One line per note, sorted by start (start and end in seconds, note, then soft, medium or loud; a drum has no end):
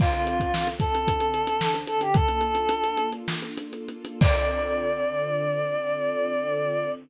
0.00 1.06 D3 medium
0.00 1.06 C4 loud
0.00 1.06 F4 medium
0.00 0.68 F4 medium
0.00 1.06 A4 medium
0.00 kick medium
0.00 crash medium
0.13 closed hi-hat medium
0.27 closed hi-hat medium
0.40 kick medium
0.40 closed hi-hat medium
0.54 snare medium
0.67 closed hi-hat medium
0.80 1.76 A4 medium
0.80 kick medium
0.80 closed hi-hat medium
0.95 closed hi-hat medium
1.07 2.13 D3 medium
1.07 2.13 C4 medium
1.07 2.13 D4 medium
1.07 2.13 A4 medium
1.07 kick medium
1.07 closed hi-hat loud
1.20 closed hi-hat medium
1.34 closed hi-hat medium
1.47 closed hi-hat medium
1.61 snare loud
1.74 closed hi-hat medium
1.87 2.00 A4 medium
1.87 closed hi-hat medium
2.01 2.14 G4 medium
2.01 closed hi-hat medium
2.14 4.19 A#3 medium
2.14 4.19 D4 medium
2.14 4.19 F4 loud
2.14 4.19 A4 medium
2.14 3.07 A4 loud
2.14 kick medium
2.14 closed hi-hat medium
2.28 closed hi-hat medium
2.41 closed hi-hat medium
2.55 closed hi-hat medium
2.69 closed hi-hat medium
2.84 closed hi-hat medium
2.97 closed hi-hat medium
3.13 closed hi-hat medium
3.28 snare loud
3.42 closed hi-hat medium
3.57 closed hi-hat medium
3.73 closed hi-hat medium
3.88 closed hi-hat medium
4.05 closed hi-hat medium
4.21 6.89 D3 loud
4.21 6.89 C4 loud
4.21 6.89 F4 medium
4.21 6.89 A4 medium
4.21 6.89 D5 loud
4.21 kick loud
4.21 crash loud